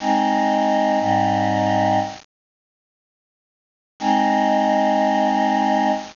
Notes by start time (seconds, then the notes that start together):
0.00 G#3 C4 D#4
1.00 G#2 G3 C4 D#4
4.00 G#3 C4 D#4